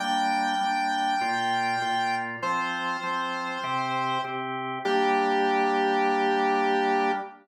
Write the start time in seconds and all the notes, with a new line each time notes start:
0.00 G3 A#3 D4 G5
0.61 G3 A#3 D4
1.21 A#2 A#3 F4
1.82 A#2 A#3 F4
2.42 F3 C4 F4 C5
3.03 F3 C4 F4
3.64 C3 C4 G4
4.24 C3 C4 G4
4.85 G3 A#3 D4 G4